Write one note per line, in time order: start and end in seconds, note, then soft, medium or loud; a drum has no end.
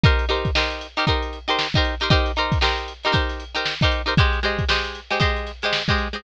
0.03 0.25 D#4 loud
0.03 0.25 G4 medium
0.03 0.25 A#4 loud
0.03 0.25 C5 medium
0.03 kick loud
0.03 closed hi-hat loud
0.19 closed hi-hat medium
0.29 0.50 D#4 medium
0.29 0.50 G4 medium
0.29 0.50 A#4 medium
0.29 0.50 C5 medium
0.29 snare soft
0.29 closed hi-hat medium
0.45 kick medium
0.45 closed hi-hat medium
0.55 0.87 D#4 medium
0.55 0.87 G4 medium
0.55 0.87 A#4 medium
0.55 0.87 C5 medium
0.55 snare loud
0.71 closed hi-hat medium
0.81 closed hi-hat medium
0.97 1.05 D#4 medium
0.97 1.05 G4 medium
0.97 1.05 A#4 medium
0.97 1.05 C5 medium
0.97 closed hi-hat medium
1.07 1.39 D#4 medium
1.07 1.39 G4 medium
1.07 1.39 A#4 medium
1.07 1.39 C5 medium
1.07 kick medium
1.07 closed hi-hat medium
1.22 closed hi-hat medium
1.33 closed hi-hat medium
1.48 1.67 D#4 medium
1.48 1.67 G4 medium
1.48 1.67 A#4 medium
1.48 1.67 C5 medium
1.48 snare soft
1.48 closed hi-hat medium
1.59 snare loud
1.74 1.95 D#4 medium
1.74 1.95 G4 medium
1.74 1.95 A#4 medium
1.74 1.95 C5 medium
1.74 kick medium
1.74 snare soft
1.74 closed hi-hat medium
1.84 closed hi-hat medium
2.00 2.09 D#4 medium
2.00 2.09 G4 medium
2.00 2.09 A#4 medium
2.00 2.09 C5 medium
2.00 closed hi-hat medium
2.10 2.32 D#4 medium
2.10 2.32 G4 loud
2.10 2.32 A#4 medium
2.10 2.32 C5 medium
2.10 kick loud
2.10 closed hi-hat loud
2.26 snare soft
2.26 closed hi-hat medium
2.36 2.58 D#4 medium
2.36 2.58 G4 medium
2.36 2.58 A#4 medium
2.36 2.58 C5 medium
2.36 closed hi-hat medium
2.52 kick medium
2.52 snare soft
2.52 closed hi-hat medium
2.61 2.93 D#4 medium
2.61 2.93 G4 medium
2.61 2.93 A#4 medium
2.61 2.93 C5 medium
2.61 snare loud
2.78 closed hi-hat medium
2.88 closed hi-hat medium
3.03 3.12 D#4 medium
3.03 3.12 G4 medium
3.03 3.13 A#4 medium
3.03 3.13 C5 medium
3.03 closed hi-hat medium
3.12 3.44 D#4 medium
3.12 3.44 G4 medium
3.12 3.44 A#4 medium
3.12 3.44 C5 medium
3.12 kick medium
3.12 closed hi-hat loud
3.29 snare soft
3.29 closed hi-hat medium
3.40 closed hi-hat medium
3.55 3.74 D#4 medium
3.55 3.74 G4 medium
3.55 3.74 A#4 medium
3.55 3.74 C5 medium
3.55 closed hi-hat medium
3.65 snare loud
3.81 4.02 D#4 medium
3.81 4.02 G4 medium
3.81 4.02 A#4 medium
3.81 4.02 C5 medium
3.81 kick medium
3.81 closed hi-hat medium
3.91 closed hi-hat medium
4.06 4.14 D#4 medium
4.06 4.14 G4 medium
4.06 4.14 A#4 medium
4.06 4.14 C5 medium
4.06 closed hi-hat medium
4.17 4.40 G#3 medium
4.17 4.40 G4 medium
4.17 4.40 C5 medium
4.17 4.40 D#5 loud
4.17 kick loud
4.17 closed hi-hat loud
4.33 snare soft
4.33 closed hi-hat medium
4.43 4.65 G#3 medium
4.43 4.65 G4 medium
4.43 4.65 C5 medium
4.43 4.65 D#5 medium
4.43 closed hi-hat medium
4.59 kick medium
4.59 closed hi-hat medium
4.68 5.01 G#3 medium
4.68 5.01 G4 medium
4.68 5.01 C5 medium
4.68 5.01 D#5 medium
4.68 snare loud
4.84 closed hi-hat medium
4.95 closed hi-hat medium
5.10 5.19 G#3 medium
5.10 5.19 G4 medium
5.10 5.19 C5 medium
5.10 5.19 D#5 medium
5.10 closed hi-hat medium
5.20 5.52 G#3 medium
5.20 5.52 G4 medium
5.20 5.52 C5 medium
5.20 5.52 D#5 medium
5.20 kick medium
5.20 closed hi-hat loud
5.36 closed hi-hat medium
5.46 snare soft
5.46 closed hi-hat medium
5.62 5.83 G#3 medium
5.62 5.83 G4 medium
5.62 5.83 C5 medium
5.62 5.83 D#5 medium
5.62 closed hi-hat medium
5.73 snare loud
5.88 6.08 G#3 medium
5.88 6.08 G4 medium
5.88 6.08 C5 medium
5.88 6.08 D#5 medium
5.88 kick medium
5.88 closed hi-hat medium
5.98 closed hi-hat medium
6.13 6.21 G#3 medium
6.13 6.21 G4 medium
6.13 6.21 C5 medium
6.13 6.21 D#5 medium
6.13 closed hi-hat medium